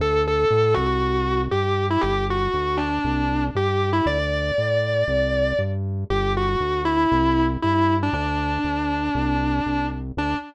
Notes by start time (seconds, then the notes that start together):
0.00 D2 A4
0.28 A4
0.51 A2
0.74 C2 F#4
1.51 G2 G4
1.90 E4
2.01 G1 G4
2.30 F#4
2.54 D2
2.77 D4
3.04 C2
3.55 G2 G4
3.93 E4
4.06 D2 D5
4.58 A2
5.08 C2
5.59 G2
6.10 G1 G4
6.37 F#4
6.60 D2
6.85 E4
7.12 C2
7.62 G2 E4
8.03 D4
8.13 D2 D4
8.64 D2
9.15 C2
9.66 C2
10.17 D2 D4